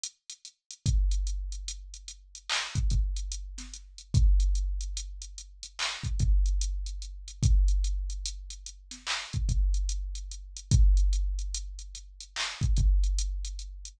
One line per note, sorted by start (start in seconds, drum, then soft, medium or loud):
0.04 closed hi-hat loud
0.30 closed hi-hat medium
0.45 closed hi-hat medium
0.71 closed hi-hat medium
0.86 kick loud
0.86 closed hi-hat loud
1.11 closed hi-hat medium
1.27 closed hi-hat medium
1.52 closed hi-hat medium
1.68 closed hi-hat loud
1.94 closed hi-hat medium
2.08 closed hi-hat medium
2.35 closed hi-hat medium
2.50 clap loud
2.76 kick medium
2.76 closed hi-hat medium
2.90 kick medium
2.90 closed hi-hat medium
3.17 closed hi-hat medium
3.32 closed hi-hat loud
3.58 snare soft
3.58 closed hi-hat medium
3.74 closed hi-hat medium
3.98 closed hi-hat medium
4.14 kick loud
4.14 closed hi-hat loud
4.40 closed hi-hat medium
4.55 closed hi-hat medium
4.81 closed hi-hat medium
4.97 closed hi-hat loud
5.22 closed hi-hat medium
5.38 closed hi-hat medium
5.63 closed hi-hat medium
5.79 clap loud
6.04 kick medium
6.04 closed hi-hat medium
6.20 kick loud
6.20 closed hi-hat medium
6.46 closed hi-hat medium
6.61 closed hi-hat loud
6.86 closed hi-hat medium
7.02 closed hi-hat medium
7.28 closed hi-hat medium
7.43 kick loud
7.43 closed hi-hat loud
7.68 closed hi-hat medium
7.84 closed hi-hat medium
8.10 closed hi-hat medium
8.26 closed hi-hat loud
8.50 closed hi-hat medium
8.66 closed hi-hat medium
8.91 snare soft
8.91 closed hi-hat medium
9.07 clap loud
9.33 kick medium
9.33 closed hi-hat medium
9.49 kick medium
9.49 closed hi-hat medium
9.74 closed hi-hat medium
9.89 closed hi-hat loud
10.15 closed hi-hat medium
10.32 closed hi-hat medium
10.57 closed hi-hat medium
10.71 kick loud
10.71 closed hi-hat loud
10.97 closed hi-hat medium
11.13 closed hi-hat medium
11.39 closed hi-hat medium
11.54 closed hi-hat loud
11.79 closed hi-hat medium
11.95 closed hi-hat medium
12.21 closed hi-hat medium
12.36 clap loud
12.61 kick loud
12.61 closed hi-hat medium
12.77 kick medium
12.77 closed hi-hat medium
13.04 closed hi-hat medium
13.19 closed hi-hat loud
13.45 closed hi-hat medium
13.59 closed hi-hat medium
13.85 closed hi-hat medium